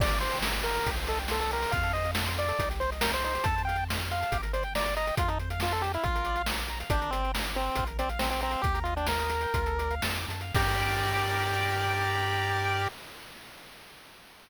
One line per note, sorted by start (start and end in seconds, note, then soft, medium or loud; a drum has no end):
0.00 0.80 G1 medium
0.00 0.10 G4 loud
0.00 0.18 D5 loud
0.00 kick loud
0.00 crash loud
0.09 0.21 A#4 medium
0.09 closed hi-hat medium
0.21 0.39 C5 loud
0.21 0.31 D5 medium
0.21 closed hi-hat medium
0.31 0.42 G5 medium
0.31 closed hi-hat medium
0.42 0.53 A#5 medium
0.42 snare loud
0.54 0.64 D6 medium
0.54 closed hi-hat medium
0.63 0.75 G4 medium
0.63 0.91 A#4 medium
0.63 closed hi-hat medium
0.75 0.85 A#4 medium
0.75 closed hi-hat medium
0.86 1.66 C2 medium
0.86 0.96 G4 medium
0.86 kick medium
0.86 closed hi-hat loud
0.96 1.07 C5 medium
0.96 closed hi-hat medium
1.07 1.19 A4 medium
1.07 1.18 D#5 medium
1.07 closed hi-hat medium
1.19 1.29 G5 medium
1.19 closed hi-hat medium
1.28 1.40 A4 medium
1.28 1.39 C6 medium
1.28 snare medium
1.40 1.51 A4 loud
1.40 1.50 D#6 medium
1.40 closed hi-hat medium
1.51 1.61 G4 medium
1.51 1.72 A#4 medium
1.51 closed hi-hat medium
1.62 1.72 C5 medium
1.62 open hi-hat medium
1.71 2.53 F2 loud
1.71 1.82 F4 medium
1.71 1.92 F5 loud
1.71 kick medium
1.71 closed hi-hat medium
1.83 1.93 A4 medium
1.83 closed hi-hat medium
1.93 2.04 C5 medium
1.93 2.11 D#5 loud
1.93 closed hi-hat medium
2.05 2.15 F5 medium
2.05 closed hi-hat medium
2.15 2.26 A5 medium
2.15 snare loud
2.26 2.36 C6 medium
2.26 closed hi-hat medium
2.37 2.47 F4 medium
2.37 2.69 D5 loud
2.37 closed hi-hat medium
2.48 2.58 A4 medium
2.48 closed hi-hat medium
2.59 3.38 C2 medium
2.59 2.69 D#4 medium
2.59 kick medium
2.59 closed hi-hat loud
2.70 2.79 G4 medium
2.70 closed hi-hat medium
2.80 2.90 C5 medium
2.80 closed hi-hat medium
2.91 3.01 D#5 medium
2.91 closed hi-hat medium
3.01 3.11 A#4 medium
3.01 3.12 G5 medium
3.01 snare loud
3.13 3.24 C5 loud
3.13 3.23 C6 medium
3.13 closed hi-hat medium
3.24 3.33 D#4 medium
3.24 3.46 C5 loud
3.24 closed hi-hat medium
3.35 3.44 G4 medium
3.35 closed hi-hat medium
3.44 4.24 F2 medium
3.44 3.55 A4 medium
3.44 3.62 A5 loud
3.44 kick loud
3.44 closed hi-hat loud
3.56 3.66 C5 medium
3.56 closed hi-hat medium
3.65 3.77 F5 medium
3.65 3.84 G5 loud
3.69 closed hi-hat medium
3.76 3.88 A5 medium
3.76 closed hi-hat medium
3.88 3.98 C6 medium
3.88 snare loud
3.99 4.09 F6 medium
3.99 closed hi-hat medium
4.10 4.38 F5 medium
4.10 4.20 C6 medium
4.10 closed hi-hat medium
4.21 4.31 A5 medium
4.21 closed hi-hat medium
4.32 5.12 G1 medium
4.32 4.41 G4 loud
4.32 kick medium
4.32 closed hi-hat loud
4.42 4.52 A#4 medium
4.42 closed hi-hat medium
4.53 4.63 C5 medium
4.53 4.63 D5 medium
4.53 closed hi-hat medium
4.63 4.74 G5 medium
4.63 closed hi-hat medium
4.75 4.84 D5 loud
4.75 4.85 A#5 medium
4.75 snare loud
4.84 4.95 D5 medium
4.84 4.95 D6 medium
4.84 closed hi-hat medium
4.96 5.15 D#5 medium
4.96 5.06 A#5 medium
4.96 closed hi-hat medium
5.07 5.17 G5 medium
5.07 closed hi-hat medium
5.17 5.98 F2 medium
5.17 5.28 F4 medium
5.17 5.29 F4 loud
5.17 kick loud
5.17 closed hi-hat loud
5.28 5.38 D#4 medium
5.28 5.38 A4 medium
5.28 closed hi-hat medium
5.39 5.49 C5 medium
5.39 closed hi-hat medium
5.50 5.60 F5 medium
5.50 closed hi-hat medium
5.60 5.73 F4 medium
5.60 5.71 A5 medium
5.60 snare loud
5.71 5.83 A4 medium
5.71 5.82 C6 medium
5.71 closed hi-hat medium
5.82 5.92 G4 medium
5.82 5.93 A5 medium
5.82 closed hi-hat medium
5.94 6.05 E4 medium
5.94 6.03 F5 medium
5.94 closed hi-hat medium
6.03 6.84 A#1 medium
6.03 6.42 F4 loud
6.03 6.14 F4 medium
6.03 kick medium
6.03 closed hi-hat medium
6.15 6.25 A#4 medium
6.15 closed hi-hat medium
6.25 6.36 D5 medium
6.25 closed hi-hat medium
6.36 6.46 F5 medium
6.36 closed hi-hat medium
6.46 6.57 A#5 medium
6.46 snare loud
6.58 6.68 D6 medium
6.58 closed hi-hat medium
6.68 6.79 A#5 medium
6.68 closed hi-hat medium
6.80 6.90 F5 medium
6.80 closed hi-hat medium
6.90 7.70 G1 loud
6.90 7.11 D4 loud
6.90 7.00 G4 loud
6.90 kick loud
6.90 closed hi-hat loud
7.02 7.11 A#4 medium
7.02 closed hi-hat medium
7.11 7.32 C4 loud
7.11 7.22 D5 medium
7.11 closed hi-hat medium
7.23 7.33 G5 medium
7.23 closed hi-hat medium
7.34 7.43 A#5 medium
7.34 snare loud
7.45 7.54 D6 medium
7.45 closed hi-hat medium
7.55 7.84 C4 loud
7.55 7.65 A#5 medium
7.55 closed hi-hat medium
7.66 7.76 G5 medium
7.75 8.56 A#1 medium
7.75 7.87 F4 medium
7.75 kick medium
7.75 closed hi-hat loud
7.87 7.97 A#4 medium
7.87 closed hi-hat medium
7.99 8.09 C4 loud
7.99 8.08 D5 medium
7.99 closed hi-hat medium
8.09 8.19 F5 medium
8.09 closed hi-hat medium
8.19 8.29 C4 loud
8.19 8.30 A#5 medium
8.19 snare loud
8.30 8.41 C4 medium
8.30 8.41 D6 medium
8.30 closed hi-hat medium
8.41 8.62 C4 loud
8.41 8.52 A#5 medium
8.41 closed hi-hat medium
8.51 8.62 F5 medium
8.51 closed hi-hat medium
8.62 9.46 D#2 medium
8.62 8.79 G4 loud
8.62 8.73 G4 medium
8.62 kick loud
8.62 closed hi-hat medium
8.74 8.84 A#4 medium
8.74 closed hi-hat medium
8.84 8.94 F4 medium
8.84 8.95 D#5 medium
8.84 closed hi-hat medium
8.96 9.07 D4 medium
8.96 9.06 G5 medium
8.96 closed hi-hat medium
9.07 9.95 A#4 medium
9.07 9.18 A#5 medium
9.07 snare loud
9.19 9.29 D#6 medium
9.19 closed hi-hat medium
9.30 9.41 A#5 medium
9.30 closed hi-hat medium
9.41 9.53 G5 medium
9.41 closed hi-hat medium
9.54 10.00 D2 loud
9.54 9.65 F4 medium
9.54 kick medium
9.54 closed hi-hat loud
9.66 9.77 A4 medium
9.66 closed hi-hat medium
9.78 9.89 D5 medium
9.78 closed hi-hat medium
9.91 10.02 F5 medium
9.91 closed hi-hat medium
10.02 10.26 F2 medium
10.02 10.15 A5 medium
10.02 snare loud
10.16 10.27 D6 medium
10.16 closed hi-hat medium
10.28 10.52 F#2 medium
10.28 10.41 A5 medium
10.28 closed hi-hat medium
10.41 10.54 F5 medium
10.41 closed hi-hat medium
10.55 12.88 G2 loud
10.55 12.88 G4 loud
10.55 12.89 G4 loud
10.55 12.88 A#4 loud
10.55 12.88 D5 loud
10.55 kick loud
10.55 crash loud